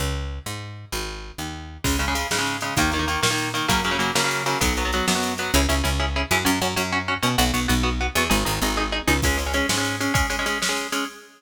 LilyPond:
<<
  \new Staff \with { instrumentName = "Overdriven Guitar" } { \time 6/8 \key cis \dorian \tempo 4. = 130 r2. | r2. | <cis gis>8 <cis gis>16 <cis gis>16 <cis gis>8 <cis gis>16 <cis gis>8. <cis gis>8 | <dis ais>8 <dis ais>16 <dis ais>16 <dis ais>8 <dis ais>16 <dis ais>8. <dis ais>8 |
<cis fis ais>8 <cis fis ais>16 <cis fis ais>16 <cis fis ais>8 <cis fis ais>16 <cis fis ais>8. <cis fis ais>8 | <fis b>8 <fis b>16 <fis b>16 <fis b>8 <fis b>16 <fis b>8. <fis b>8 | <cis' e' gis'>8 <cis' e' gis'>8 <cis' e' gis'>8 <cis' e' gis'>8 <cis' e' gis'>8 <cis' e' gis'>8 | <cis' fis'>8 <cis' fis'>8 <cis' fis'>8 <cis' fis'>8 <cis' fis'>8 <cis' fis'>8 |
<b fis'>8 <b fis'>8 <b fis'>8 <b fis'>8 <b fis'>8 <b fis'>8 | <dis' gis'>8 <dis' gis'>8 <dis' gis'>8 <dis' gis'>8 <dis' gis'>8 <dis' gis'>8 | <gis cis'>8 <gis cis'>16 <gis cis'>16 <gis cis'>8 <gis cis'>16 <gis cis'>8. <gis cis'>8 | <gis cis'>8 <gis cis'>16 <gis cis'>16 <gis cis'>8 <gis cis'>16 <gis cis'>8. <gis cis'>8 | }
  \new Staff \with { instrumentName = "Electric Bass (finger)" } { \clef bass \time 6/8 \key cis \dorian cis,4. gis,4. | gis,,4. dis,4. | cis,4. gis,4. | dis,4. ais,4. |
fis,4. cis4. | b,,4. fis,4. | cis,8 cis,8 cis,4. fis,8 | fis,8 fis,8 fis,4. b,8 |
b,,8 b,,8 b,,4. e,8 | gis,,8 gis,,8 gis,,4. cis,8 | cis,4. gis,4. | r2. | }
  \new DrumStaff \with { instrumentName = "Drums" } \drummode { \time 6/8 r4. r4. | r4. r4. | <cymc bd>8 cymr8 cymr8 sn8 cymr8 cymr8 | <bd cymr>8 cymr8 cymr8 sn8 cymr8 cymr8 |
<bd cymr>8 cymr8 cymr8 sn8 cymr8 cymr8 | <bd cymr>8 cymr8 cymr8 sn8 cymr8 cymr8 | r4. r4. | r4. r4. |
r4. r4. | r4. r4. | <cymc bd>8 cymr8 cymr8 sn8 cymr8 cymr8 | <bd cymr>8 cymr8 cymr8 sn8 cymr8 cymr8 | }
>>